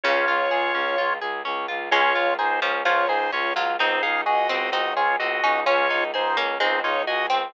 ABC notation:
X:1
M:2/2
L:1/8
Q:1/2=64
K:Db
V:1 name="Drawbar Organ"
[Fd]5 z3 | [Fd]2 [Ec] z [Fd] [Ec] [Fd] z | [Ec] [Af] [Ge]2 [Ge] [Fd] [Ge]2 | [Fd]2 [Ec] z [Ec] [Fd] [Ge] z |]
V:2 name="Harpsichord"
D,2 z6 | A,2 z F, F,3 G, | E2 z C C3 D | D2 z B, A,3 C |]
V:3 name="Orchestral Harp"
D F A D F A D F | D F A D F A D F | C E A C E A C E | D E A D C E A C |]
V:4 name="Violin" clef=bass
D,, D,, D,, D,, D,, D,, D,, D,, | D,, D,, D,, D,, D,, D,, D,, D,, | D,, D,, D,, D,, D,, D,, D,, D,, | D,, D,, D,, D,, D,, D,, D,, D,, |]